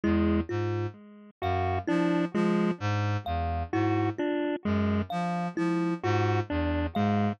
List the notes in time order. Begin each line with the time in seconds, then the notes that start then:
0.03 E2 G#3 E4
0.49 G#2 F4
1.42 F#2 F#4 F5
1.88 F3 D4 E4
2.34 F3 G#3 F4
2.80 G#2
3.26 E2 F5
3.73 G#2 E4 F#4
4.18 D4 F4
4.65 F#2 G#3
5.10 F3 F5
5.57 F3 E4
6.03 G#2 F4 F#4
6.50 E2 D4
6.95 G#2 G#3 F5